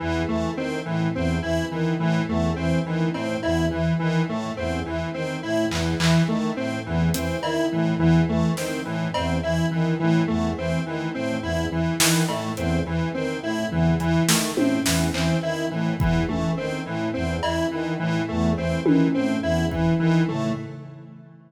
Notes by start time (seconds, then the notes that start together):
0.00 E2 E3
0.27 E3 A3
0.55 D#3 C4
0.85 A2 E3
1.15 E2 C4
1.42 E3 E4
1.71 D#3 E3
1.99 A2 E3
2.28 E2 A3
2.56 E3 C4
2.85 D#3 E3
3.14 A2 C4, cowbell
3.43 E2 E4, cowbell
3.71 E3
3.99 D#3 E3
4.28 A2 A3
4.57 E2 C4
4.86 E3
5.14 D#3 C4
5.43 A2 E4
5.70 E2 E3, clap
6.00 E3, clap
6.27 D#3 A3
6.56 A2 C4
6.86 E2 E3
7.14 E3 C4, closed hi-hat
7.42 D#3 E4, cowbell
7.72 A2 E3
7.98 E2 E3
8.28 E3 A3
8.57 D#3 C4, snare
8.85 A2 E3
9.14 E2 C4, cowbell
9.43 E3 E4
9.71 D#3 E3
10.00 A2 E3
10.28 E2 A3
10.56 E3 C4
10.86 D#3 E3
11.14 A2 C4
11.42 E2 E4
11.71 E3
12.00 D#3 E3, snare
12.29 A2 A3, cowbell
12.56 E2 C4, closed hi-hat
12.86 E3
13.14 D#3 C4
13.43 A2 E4
13.71 E2 E3, floor tom
14.00 E3, closed hi-hat
14.28 D#3 A3, snare
14.56 A2 C4, high tom
14.85 E2 E3, snare
15.13 E3 C4, clap
15.43 D#3 E4
15.71 A2 E3
15.99 E2 E3, kick
16.28 E3 A3, high tom
16.57 D#3 C4
16.86 A2 E3
17.14 E2 C4
17.43 E3 E4, cowbell
17.71 D#3 E3
17.99 A2 E3
18.28 E2 A3
18.57 E3 C4
18.85 D#3 E3, high tom
19.14 A2 C4
19.42 E2 E4
19.71 E3, kick
19.99 D#3 E3
20.28 A2 A3, floor tom